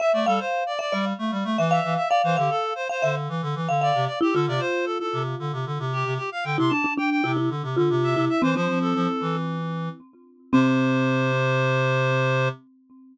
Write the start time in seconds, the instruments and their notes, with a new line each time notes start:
0.00 clarinet E5, marimba E5
0.13 clarinet A3 D5
0.26 clarinet G3 A4, marimba F5
0.39 clarinet C5
0.66 clarinet D5
0.79 clarinet D5, marimba E5
0.92 clarinet G3, marimba D5
1.19 clarinet A3
1.31 clarinet G3
1.44 clarinet A3
1.58 clarinet E3, marimba E5
1.71 clarinet E5, marimba F5
1.84 clarinet E3
1.96 clarinet E5
2.09 clarinet D5, marimba F5
2.24 clarinet E3 C5
2.37 clarinet D3 G4, marimba F5
2.50 clarinet A4
2.75 clarinet C5
2.89 clarinet C5, marimba F5
3.02 clarinet D3, marimba E5
3.29 clarinet E3
3.42 clarinet D3
3.55 clarinet E3
3.69 clarinet D3, marimba F5
3.81 clarinet D5, marimba F5
3.95 clarinet C3
4.07 clarinet D5
4.21 marimba E4, clarinet G4
4.33 clarinet D3 A4, marimba F4
4.47 clarinet C3 D5
4.60 clarinet C5
4.85 clarinet A4
5.00 clarinet A4
5.13 clarinet C3
5.39 clarinet D3
5.53 clarinet C3
5.66 clarinet D3
5.79 clarinet C3
5.93 clarinet G4
6.05 clarinet C3
6.17 clarinet G4
6.32 clarinet F5
6.44 clarinet D3 G5
6.58 clarinet C3 C6, marimba E4
6.70 marimba D4, clarinet A5
6.84 marimba D4
6.97 marimba D4, clarinet G5
7.10 clarinet G5
7.24 clarinet C3, marimba E4
7.37 marimba E4
7.50 clarinet D3
7.63 clarinet C3
7.76 clarinet D3, marimba F4
7.90 clarinet C3
8.03 clarinet E5
8.16 clarinet C3, marimba E4
8.29 clarinet E5
8.42 clarinet E3 C5, marimba C4
8.55 clarinet F3 C5, marimba C4
8.68 clarinet F3
8.81 clarinet A4
8.95 clarinet F3
9.21 clarinet E3
10.53 clarinet C3 C5, marimba C4